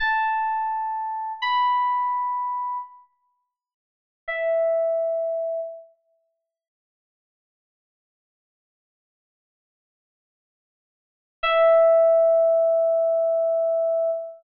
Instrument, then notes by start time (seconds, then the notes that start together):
electric piano 2
0.00 A5
1.42 B5
4.28 E5
11.43 E5